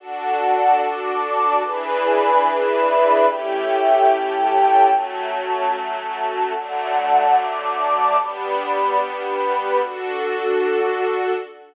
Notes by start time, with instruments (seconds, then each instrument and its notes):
0.00 string ensemble 1 D4 F#4 A4, pad 2 (warm) D5 F#5 A5
0.81 pad 2 (warm) D5 A5 D6
1.64 string ensemble 1 E3 D4 G#4 B4, pad 2 (warm) E4 D5 G#5 B5
2.44 pad 2 (warm) E4 D5 E5 B5
3.27 string ensemble 1 A3 C#4 E4 G4, pad 2 (warm) A4 C#5 E5 G5
4.09 pad 2 (warm) A4 C#5 G5 A5
4.91 string ensemble 1 F#3 A3 C#4, pad 2 (warm) F#4 C#5 A5
5.73 pad 2 (warm) F#4 A4 A5
6.53 string ensemble 1 D3 F#3 A3, pad 2 (warm) D5 F#5 A5
7.35 pad 2 (warm) D5 A5 D6
8.19 string ensemble 1 G3 B3 D4, pad 2 (warm) G4 D5 B5
8.98 pad 2 (warm) G4 B4 B5
9.80 pad 2 (warm) D4 F#4 A4, string ensemble 1 D4 F#4 A4